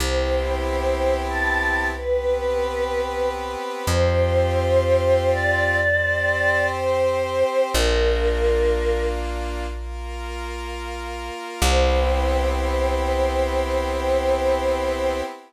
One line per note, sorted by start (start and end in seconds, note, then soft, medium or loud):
0.00 3.56 C2 medium
0.00 1.91 B3 medium
0.00 1.91 C4 medium
0.00 1.91 E4 loud
0.00 1.91 G4 loud
0.00 0.62 C5 loud
0.64 1.18 C5 medium
1.29 1.84 A5 loud
1.93 3.85 B3 medium
1.93 3.85 C4 medium
1.93 3.85 G4 medium
1.93 3.85 B4 loud
1.93 3.28 B4 loud
3.87 7.43 F2 medium
3.87 5.78 C4 loud
3.87 5.78 F4 medium
3.87 5.78 G4 medium
3.87 5.28 C5 loud
5.32 6.65 D5 loud
5.80 7.72 C4 medium
5.80 7.72 G4 medium
5.80 7.72 C5 loud
6.77 7.64 C5 loud
7.73 11.31 A#1 medium
7.73 9.65 A#3 loud
7.73 9.65 D4 medium
7.73 9.65 F4 medium
7.73 9.03 A#4 loud
9.69 11.60 A#3 medium
9.69 11.60 F4 medium
9.69 11.60 A#4 loud
11.61 15.22 C2 loud
11.61 15.22 B3 loud
11.61 15.22 C4 loud
11.61 15.22 E4 medium
11.61 15.22 G4 loud
11.61 15.22 C5 loud